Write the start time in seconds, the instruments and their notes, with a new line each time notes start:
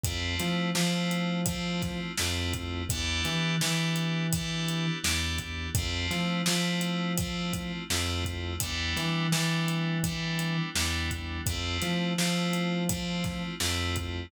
0.03 synth bass 1 F2, electric piano 2 A3 C4 E4 F4, kick, closed hi-hat
0.39 synth bass 1 F3, snare, closed hi-hat
0.75 synth bass 1 F3, electric piano 2 A3 C4 E4 F4, snare
1.11 closed hi-hat
1.46 electric piano 2 A3 C4 E4 F4, kick, closed hi-hat
1.82 kick, snare, closed hi-hat
2.17 synth bass 1 F2, electric piano 2 A3 C4 E4 F4, snare
2.53 kick, closed hi-hat
2.89 synth bass 1 E2, electric piano 2 B3 D4 E4 G4, kick, closed hi-hat
3.24 synth bass 1 E3, snare, closed hi-hat
3.61 synth bass 1 E3, electric piano 2 B3 D4 E4 G4, snare
3.96 closed hi-hat
4.32 electric piano 2 B3 D4 E4 G4, kick, closed hi-hat
4.68 closed hi-hat
5.03 synth bass 1 E2, electric piano 2 B3 D4 E4 G4, snare
5.38 kick, closed hi-hat
5.75 synth bass 1 F2, electric piano 2 A3 C4 E4 F4, kick, closed hi-hat
6.11 synth bass 1 F3, snare, closed hi-hat
6.46 synth bass 1 F3, electric piano 2 A3 C4 E4 F4, snare
6.81 closed hi-hat
7.17 electric piano 2 A3 C4 E4 F4, kick, closed hi-hat
7.53 kick, closed hi-hat
7.90 synth bass 1 F2, electric piano 2 A3 C4 E4 F4, snare
8.25 kick, closed hi-hat
8.60 synth bass 1 E2, electric piano 2 G3 B3 D4 E4, kick, closed hi-hat
8.96 synth bass 1 E3, snare, closed hi-hat
9.32 synth bass 1 E3, electric piano 2 G3 B3 D4 E4, snare
9.68 closed hi-hat
10.04 electric piano 2 G3 B3 D4 E4, kick, closed hi-hat
10.39 closed hi-hat
10.75 synth bass 1 E2, electric piano 2 G3 B3 D4 E4, snare
11.11 kick, closed hi-hat
11.46 synth bass 1 F2, electric piano 2 A3 C4 E4 F4, kick, closed hi-hat
11.82 synth bass 1 F3, snare, closed hi-hat
12.18 synth bass 1 F3, electric piano 2 A3 C4 E4 F4, snare
12.53 closed hi-hat
12.89 electric piano 2 A3 C4 E4 F4, kick, closed hi-hat
13.24 kick, snare, closed hi-hat
13.60 synth bass 1 F2, electric piano 2 A3 C4 E4 F4, snare
13.96 kick, closed hi-hat